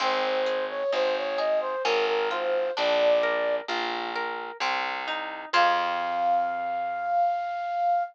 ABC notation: X:1
M:3/4
L:1/16
Q:1/4=65
K:Fm
V:1 name="Flute"
c c2 d c d e c B B c2 | =d4 z8 | f12 |]
V:2 name="Orchestral Harp"
C2 A2 E2 A2 D2 F2 | =D2 B2 F2 B2 C2 E2 | [CFA]12 |]
V:3 name="Electric Bass (finger)" clef=bass
A,,,4 A,,,4 A,,,4 | B,,,4 B,,,4 C,,4 | F,,12 |]